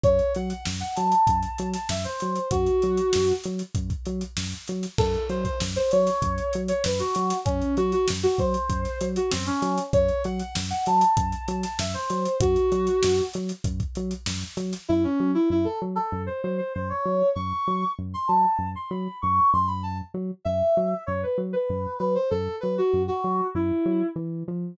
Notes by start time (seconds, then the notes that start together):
0.03 F#2 C#5, kick, closed hi-hat
0.19 closed hi-hat
0.35 F#3 F#5, closed hi-hat
0.49 F#5, closed hi-hat
0.65 F#2, snare
0.80 F#5, closed hi-hat
0.95 F#3 A5, closed hi-hat
1.12 closed hi-hat
1.27 F#2, kick, closed hi-hat
1.43 closed hi-hat
1.58 F#3, closed hi-hat
1.74 A5, snare, closed hi-hat
1.89 F#2 E5, snare
2.04 C5, closed hi-hat
2.20 F#3, closed hi-hat
2.36 closed hi-hat
2.51 F#2 F#4, kick, closed hi-hat
2.66 closed hi-hat
2.82 F#3, closed hi-hat
2.97 closed hi-hat
3.13 F#2, snare
3.28 closed hi-hat
3.44 F#3, closed hi-hat
3.59 closed hi-hat
3.75 F#2, kick, closed hi-hat
3.90 kick, closed hi-hat
4.06 F#3, closed hi-hat
4.21 closed hi-hat
4.37 F#2, snare
4.52 closed hi-hat
4.68 F#3, closed hi-hat
4.83 snare, closed hi-hat
4.98 F#2 A4, kick, crash
5.14 closed hi-hat
5.30 F#3 C5, closed hi-hat
5.44 C5, kick, closed hi-hat
5.60 F#2, snare
5.76 C5, closed hi-hat
5.91 F#3 C#5, closed hi-hat
6.07 snare, closed hi-hat
6.22 F#2, kick, closed hi-hat
6.38 closed hi-hat
6.53 F#3, closed hi-hat
6.68 C#5, closed hi-hat
6.84 F#2 B4, snare
6.99 F#4, snare, closed hi-hat
7.15 F#3, closed hi-hat
7.30 snare, closed hi-hat
7.45 F#2 C#4, kick, closed hi-hat
7.61 closed hi-hat
7.77 F#3 F#4, closed hi-hat
7.92 F#4, closed hi-hat
8.08 F#2, snare
8.23 F#4, closed hi-hat
8.38 F#3 C5, kick, closed hi-hat
8.54 closed hi-hat
8.69 F#2, kick, closed hi-hat
8.85 snare, closed hi-hat
9.01 F#3, closed hi-hat
9.16 F#4, closed hi-hat
9.31 F#2 C4, snare
9.46 C#4, closed hi-hat
9.62 F#3, snare, closed hi-hat
9.78 closed hi-hat
9.93 F#2 C#5, kick, closed hi-hat
10.09 closed hi-hat
10.24 F#3 F#5, closed hi-hat
10.40 F#5, closed hi-hat
10.55 F#2, snare
10.70 F#5, closed hi-hat
10.86 F#3 A5, closed hi-hat
11.01 closed hi-hat
11.17 F#2, kick, closed hi-hat
11.32 closed hi-hat
11.48 F#3, closed hi-hat
11.63 A5, snare, closed hi-hat
11.79 F#2 E5, snare
11.94 C5, closed hi-hat
12.10 F#3, closed hi-hat
12.25 closed hi-hat
12.40 F#2 F#4, kick, closed hi-hat
12.56 closed hi-hat
12.72 F#3, closed hi-hat
12.87 closed hi-hat
13.03 F#2, snare
13.18 closed hi-hat
13.34 F#3, closed hi-hat
13.49 closed hi-hat
13.64 F#2, kick, closed hi-hat
13.80 kick, closed hi-hat
13.95 F#3, closed hi-hat
14.11 closed hi-hat
14.26 F#2, snare
14.42 closed hi-hat
14.57 F#3, closed hi-hat
14.73 snare, closed hi-hat
14.89 F#2 E4
15.03 C#4
15.20 F#3
15.34 E4
15.50 F#2 E4
15.65 A4
15.82 F#3
15.95 A4
16.12 F#2
16.26 C5
16.43 F#3 C5
16.58 C5
16.74 F#2 C5
16.89 C#5
17.06 F#3
17.35 F#2 C#6
17.68 F#3
17.99 F#2
18.14 C6
18.28 F#3 A5
18.59 F#2
18.76 C6
18.90 F#3 B5
19.22 F#2 C#6
19.53 F#2 C6
19.67 B5
19.83 A5
20.14 F#3
20.45 F#2 E5
20.77 F#3
21.06 F#2 C#5
21.23 B4
21.38 F#3
21.53 B4
21.70 F#2
21.99 F#3 B4
22.15 C5
22.30 F#2 A4
22.60 F#3 B4
22.78 F#4
22.93 F#2
23.08 F#4
23.24 F#3
23.55 F#2 E4
23.86 F#3
24.16 E3
24.48 F3